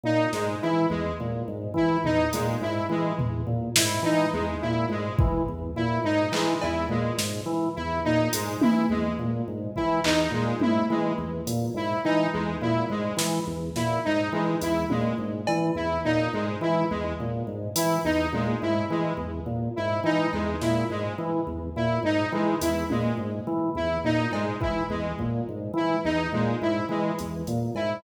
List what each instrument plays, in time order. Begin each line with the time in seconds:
0.03 drawbar organ A#2, lead 1 (square) D#4
0.33 drawbar organ G#2, lead 1 (square) G#3, snare
0.62 drawbar organ E3, lead 1 (square) E4
0.90 drawbar organ E2, lead 1 (square) G#3
1.20 drawbar organ A#2
1.48 drawbar organ G#2
1.74 drawbar organ E3, lead 1 (square) E4, kick
2.04 drawbar organ E2, lead 1 (square) D#4, floor tom
2.33 drawbar organ A#2, lead 1 (square) G#3, closed hi-hat
2.61 drawbar organ G#2, lead 1 (square) E4
2.89 drawbar organ E3, lead 1 (square) G#3
3.19 drawbar organ E2, floor tom
3.47 drawbar organ A#2
3.76 drawbar organ G#2, lead 1 (square) E4, snare
4.03 drawbar organ E3, lead 1 (square) D#4, cowbell
4.33 drawbar organ E2, lead 1 (square) G#3
4.61 drawbar organ A#2, lead 1 (square) E4
4.89 drawbar organ G#2, lead 1 (square) G#3
5.19 drawbar organ E3, kick
5.48 drawbar organ E2
5.76 drawbar organ A#2, lead 1 (square) E4
6.04 drawbar organ G#2, lead 1 (square) D#4
6.32 drawbar organ E3, lead 1 (square) G#3, clap
6.61 drawbar organ E2, lead 1 (square) E4, cowbell
6.89 drawbar organ A#2, lead 1 (square) G#3
7.18 drawbar organ G#2, snare
7.46 drawbar organ E3
7.75 drawbar organ E2, lead 1 (square) E4
8.04 drawbar organ A#2, lead 1 (square) D#4
8.33 drawbar organ G#2, lead 1 (square) G#3, closed hi-hat
8.61 drawbar organ E3, lead 1 (square) E4, high tom
8.89 drawbar organ E2, lead 1 (square) G#3
9.19 drawbar organ A#2
9.48 drawbar organ G#2
9.76 drawbar organ E3, lead 1 (square) E4, kick
10.04 drawbar organ E2, lead 1 (square) D#4, clap
10.31 drawbar organ A#2, lead 1 (square) G#3
10.60 drawbar organ G#2, lead 1 (square) E4, high tom
10.90 drawbar organ E3, lead 1 (square) G#3
11.18 drawbar organ E2
11.47 drawbar organ A#2, closed hi-hat
11.74 drawbar organ G#2, lead 1 (square) E4
12.04 drawbar organ E3, lead 1 (square) D#4
12.33 drawbar organ E2, lead 1 (square) G#3
12.61 drawbar organ A#2, lead 1 (square) E4
12.90 drawbar organ G#2, lead 1 (square) G#3
13.17 drawbar organ E3, snare
13.47 drawbar organ E2
13.76 drawbar organ A#2, lead 1 (square) E4, snare
14.05 drawbar organ G#2, lead 1 (square) D#4
14.33 drawbar organ E3, lead 1 (square) G#3
14.61 drawbar organ E2, lead 1 (square) E4, closed hi-hat
14.90 drawbar organ A#2, lead 1 (square) G#3, high tom
15.18 drawbar organ G#2
15.47 drawbar organ E3, cowbell
15.75 drawbar organ E2, lead 1 (square) E4
16.04 drawbar organ A#2, lead 1 (square) D#4
16.33 drawbar organ G#2, lead 1 (square) G#3
16.61 drawbar organ E3, lead 1 (square) E4
16.90 drawbar organ E2, lead 1 (square) G#3
17.20 drawbar organ A#2
17.47 drawbar organ G#2
17.76 drawbar organ E3, lead 1 (square) E4, closed hi-hat
18.04 drawbar organ E2, lead 1 (square) D#4
18.33 drawbar organ A#2, lead 1 (square) G#3, high tom
18.62 drawbar organ G#2, lead 1 (square) E4
18.90 drawbar organ E3, lead 1 (square) G#3
19.17 drawbar organ E2
19.46 drawbar organ A#2
19.76 drawbar organ G#2, lead 1 (square) E4
20.04 drawbar organ E3, lead 1 (square) D#4
20.33 drawbar organ E2, lead 1 (square) G#3, cowbell
20.61 drawbar organ A#2, lead 1 (square) E4, snare
20.90 drawbar organ G#2, lead 1 (square) G#3
21.18 drawbar organ E3
21.47 drawbar organ E2
21.76 drawbar organ A#2, lead 1 (square) E4
22.03 drawbar organ G#2, lead 1 (square) D#4
22.32 drawbar organ E3, lead 1 (square) G#3
22.61 drawbar organ E2, lead 1 (square) E4, closed hi-hat
22.90 drawbar organ A#2, lead 1 (square) G#3, high tom
23.17 drawbar organ G#2
23.47 drawbar organ E3
23.75 drawbar organ E2, lead 1 (square) E4
24.04 drawbar organ A#2, lead 1 (square) D#4
24.32 drawbar organ G#2, lead 1 (square) G#3, cowbell
24.60 drawbar organ E3, lead 1 (square) E4, kick
24.90 drawbar organ E2, lead 1 (square) G#3
25.19 drawbar organ A#2, kick
25.49 drawbar organ G#2
25.74 drawbar organ E3, lead 1 (square) E4
26.04 drawbar organ E2, lead 1 (square) D#4
26.33 drawbar organ A#2, lead 1 (square) G#3
26.61 drawbar organ G#2, lead 1 (square) E4
26.89 drawbar organ E3, lead 1 (square) G#3
27.19 drawbar organ E2, closed hi-hat
27.47 drawbar organ A#2, closed hi-hat
27.75 drawbar organ G#2, lead 1 (square) E4, cowbell